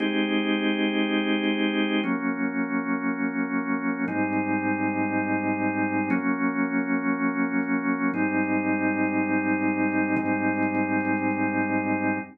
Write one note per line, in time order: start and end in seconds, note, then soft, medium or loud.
0.00 2.01 G#3 medium
0.00 2.01 C4 medium
0.00 2.01 D#4 medium
0.00 2.01 G4 medium
2.03 4.05 F#3 medium
2.03 4.05 A#3 medium
2.03 4.05 C#4 medium
4.08 6.09 G#2 loud
4.08 6.09 G3 medium
4.08 6.09 C4 medium
4.08 6.09 D#4 medium
6.10 8.11 F#3 loud
6.10 8.11 A#3 medium
6.10 8.11 C#4 loud
8.14 10.15 G#2 medium
8.14 10.15 G3 loud
8.14 10.15 C4 medium
8.14 10.15 D#4 loud
10.17 12.18 G#2 loud
10.17 12.18 G3 medium
10.17 12.18 C4 medium
10.17 12.18 D#4 medium